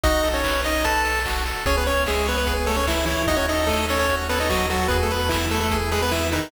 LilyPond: <<
  \new Staff \with { instrumentName = "Lead 1 (square)" } { \time 4/4 \key e \major \tempo 4 = 148 <dis' dis''>8. <cis' cis''>8. <dis' dis''>8 <a' a''>4 r4 | <cis' cis''>16 <b b'>16 <cis' cis''>8 <gis gis'>8 <b b'>16 <b b'>8 r16 <a a'>16 <cis' cis''>16 <e e'>8 <e e'>8 | <dis' dis''>16 <cis' cis''>16 <dis' dis''>8 <a a'>8 <cis' cis''>16 <cis' cis''>8 r16 <b b'>16 <dis' dis''>16 <fis fis'>8 <fis fis'>8 | <b b'>16 <a a'>16 <b b'>8 <e e'>8 <a a'>16 <a a'>8 r16 <gis gis'>16 <b b'>16 <e e'>8 <dis dis'>8 | }
  \new Staff \with { instrumentName = "Lead 1 (square)" } { \time 4/4 \key e \major fis'8 a'8 b'8 dis''8 b'8 a'8 fis'8 a'8 | gis'8 cis''8 e''8 cis''8 gis'8 cis''8 e''8 cis''8 | fis'8 a'8 dis''8 a'8 fis'8 a'8 dis''8 a'8 | gis'8 b'8 e''8 b'8 gis'8 b'8 e''8 b'8 | }
  \new Staff \with { instrumentName = "Synth Bass 1" } { \clef bass \time 4/4 \key e \major b,,1 | cis,1 | dis,1 | e,1 | }
  \new DrumStaff \with { instrumentName = "Drums" } \drummode { \time 4/4 <hh bd>8 hho8 <hc bd>8 hho8 <hh bd>8 hho8 <hc bd>8 hho8 | <hh bd>8 hho8 <hc bd>8 hho8 <hh bd>8 hho8 <hc bd>8 hho8 | <hh bd>8 hho8 <hc bd>8 hho8 <hh bd>8 hho8 <hc bd>8 hho8 | <hh bd>8 hho8 <hc bd>8 hho8 <hh bd>8 hho8 hc8 hho8 | }
>>